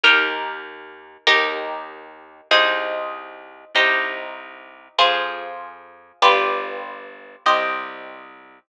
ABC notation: X:1
M:4/4
L:1/8
Q:1/4=97
K:Cm
V:1 name="Orchestral Harp"
[EGB]4 | [EGB]4 [EAc]4 | [EGc]4 [FAc]4 | [FG=Bd]4 [Gce]4 |]
V:2 name="Electric Bass (finger)" clef=bass
E,,4 | E,,4 C,,4 | C,,4 F,,4 | G,,,4 C,,4 |]